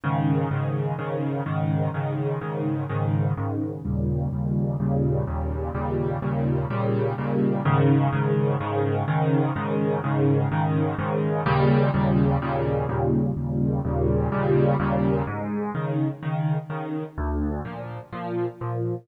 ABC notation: X:1
M:4/4
L:1/8
Q:1/4=126
K:Ab
V:1 name="Acoustic Grand Piano" clef=bass
[A,,D,E,]2 [A,,D,E,]2 [A,,D,E,]2 [A,,D,E,]2 | [A,,D,E,]2 [A,,D,E,]2 [A,,D,E,]2 [A,,D,E,]2 | [E,,B,,D,G,]2 [E,,B,,D,G,]2 [E,,B,,D,G,]2 [E,,B,,D,G,]2 | [E,,B,,D,G,]2 [E,,B,,D,G,]2 [E,,B,,D,G,]2 [E,,B,,D,G,]2 |
[A,,D,E,]2 [A,,D,E,]2 [A,,D,E,]2 [A,,D,E,]2 | [A,,D,E,]2 [A,,D,E,]2 [A,,D,E,]2 [A,,D,E,]2 | [E,,B,,D,G,]2 [E,,B,,D,G,]2 [E,,B,,D,G,]2 [E,,B,,D,G,]2 | [E,,B,,D,G,]2 [E,,B,,D,G,]2 [E,,B,,D,G,]2 [E,,B,,D,G,]2 |
A,,2 [D,E,]2 [D,E,]2 [D,E,]2 | =D,,2 [B,,F,]2 [B,,F,]2 [B,,F,]2 |]